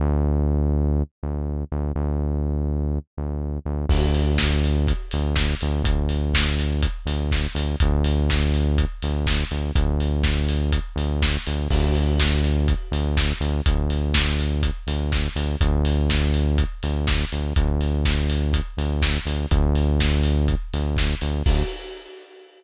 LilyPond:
<<
  \new Staff \with { instrumentName = "Synth Bass 1" } { \clef bass \time 4/4 \key d \dorian \tempo 4 = 123 d,2~ d,8 d,4 d,8 | d,2~ d,8 d,4 d,8 | d,2~ d,8 d,4 d,8 | d,2~ d,8 d,4 d,8 |
d,2~ d,8 d,4 d,8 | d,2~ d,8 d,4 d,8 | d,2~ d,8 d,4 d,8 | d,2~ d,8 d,4 d,8 |
d,2~ d,8 d,4 d,8 | d,2~ d,8 d,4 d,8 | d,2~ d,8 d,4 d,8 | d,4 r2. | }
  \new DrumStaff \with { instrumentName = "Drums" } \drummode { \time 4/4 r4 r4 r4 r4 | r4 r4 r4 r4 | <cymc bd>8 hho8 <bd sn>8 hho8 <hh bd>8 hho8 <bd sn>8 hho8 | <hh bd>8 hho8 <bd sn>8 hho8 <hh bd>8 hho8 <bd sn>8 hho8 |
<hh bd>8 hho8 <bd sn>8 hho8 <hh bd>8 hho8 <bd sn>8 hho8 | <hh bd>8 hho8 <bd sn>8 hho8 <hh bd>8 hho8 <bd sn>8 hho8 | <cymc bd>8 hho8 <bd sn>8 hho8 <hh bd>8 hho8 <bd sn>8 hho8 | <hh bd>8 hho8 <bd sn>8 hho8 <hh bd>8 hho8 <bd sn>8 hho8 |
<hh bd>8 hho8 <bd sn>8 hho8 <hh bd>8 hho8 <bd sn>8 hho8 | <hh bd>8 hho8 <bd sn>8 hho8 <hh bd>8 hho8 <bd sn>8 hho8 | <hh bd>8 hho8 <bd sn>8 hho8 <hh bd>8 hho8 <bd sn>8 hho8 | <cymc bd>4 r4 r4 r4 | }
>>